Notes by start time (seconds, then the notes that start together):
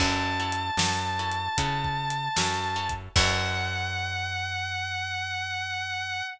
0.00 F#2 C#4 E4 F#4 A4 A5, kick, crash
0.40 C#4 E4 F#4 A4
0.52 closed hi-hat
0.77 F#2 C#4 E4 F#4 A4, snare
1.19 C#4 E4 F#4 A4
1.32 closed hi-hat
1.58 C#3 C#4 E4 F#4 A4, kick, closed hi-hat
1.84 kick
2.10 closed hi-hat
2.36 F#2 C#4 E4 F#4 A4, snare
2.76 C#4 E4 F#4 A4
2.89 kick, closed hi-hat
3.16 F#2 C#4 E4 F#4 A4 F#5, kick, crash